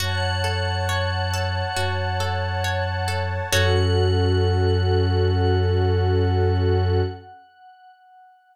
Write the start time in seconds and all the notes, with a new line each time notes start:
0.00 F#2 F#4 C#5 F#5 A5
0.44 A4
0.89 C#5
1.33 A4
1.76 F#2 F#4
2.20 A4
2.64 C#5
3.08 A4
3.53 F#2 C#4 F#4 A4 C#5 F#5